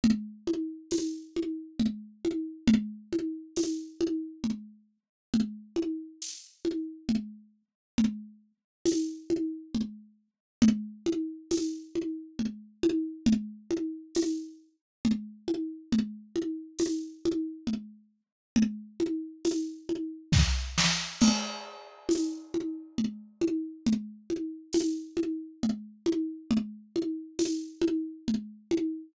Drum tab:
CC |------|------|------|------|
TB |--x---|--x---|--x---|--x---|
SD |------|------|------|------|
CG |OoooOo|OoooO-|Oo-oO-|O-ooO-|
BD |------|------|------|------|

CC |------|------|------|------|
TB |--x---|--x---|--x---|--x---|
SD |------|------|------|----oo|
CG |OoooOo|Ooo-Oo|OoooO-|Oooo--|
BD |------|------|------|----o-|

CC |x-----|------|------|
TB |--x---|--x---|--x---|
SD |------|------|------|
CG |O-ooOo|OoooOo|OoooOo|
BD |------|------|------|